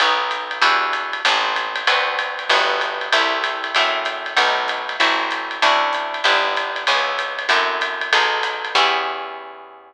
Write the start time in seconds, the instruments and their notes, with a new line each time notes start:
0.00 electric bass (finger) B1, acoustic guitar (steel) B3 D#4 F#4 A4, kick, ride
0.31 hi-hat pedal, ride
0.51 ride
0.62 electric bass (finger) E2, acoustic guitar (steel) D4 E4 F#4 G4, kick, ride
0.93 hi-hat pedal, ride
1.13 ride
1.25 electric bass (finger) A1, acoustic guitar (steel) B3 C4 G4 A4, kick, ride
1.56 hi-hat pedal, ride
1.76 ride
1.87 electric bass (finger) D2, acoustic guitar (steel) B3 C4 D4 F#4, kick, ride
2.19 hi-hat pedal, ride
2.39 ride
2.49 electric bass (finger) G1, acoustic guitar (steel) A3 B3 F#4 G4, kick, ride
2.81 hi-hat pedal, ride
3.01 ride
3.12 electric bass (finger) C2, acoustic guitar (steel) A3 C4 E4 G4, kick, ride
3.44 hi-hat pedal, ride
3.64 ride
3.75 electric bass (finger) F#2, acoustic guitar (steel) A3 C4 E4 F#4, kick, ride
4.05 hi-hat pedal, ride
4.26 ride
4.37 electric bass (finger) B1, acoustic guitar (steel) A3 B3 D#4 F#4, kick, ride
4.68 hi-hat pedal, ride
4.89 ride
5.00 electric bass (finger) A1, acoustic guitar (steel) A3 C4 E4 F#4, kick, ride
5.31 hi-hat pedal, ride
5.51 ride
5.62 electric bass (finger) D2, acoustic guitar (steel) C#4 D4 E4 F#4, kick, ride
5.93 hi-hat pedal, ride
6.14 ride
6.24 electric bass (finger) G1, acoustic guitar (steel) B3 D4 E4 G4, kick, ride
6.57 hi-hat pedal, ride
6.76 ride
6.87 electric bass (finger) C#2, acoustic guitar (steel) B3 C#4 E4 G#4, kick, ride
7.19 hi-hat pedal, ride
7.39 ride
7.49 electric bass (finger) F#2, acoustic guitar (steel) C4 E4 F#4 A4, kick, ride
7.81 hi-hat pedal, ride
8.01 ride
8.12 electric bass (finger) B1, acoustic guitar (steel) B3 D#4 G#4 A4, kick, ride
8.43 hi-hat pedal, ride
8.65 ride
8.75 electric bass (finger) E2, acoustic guitar (steel) B3 C#4 E4 G4, kick, crash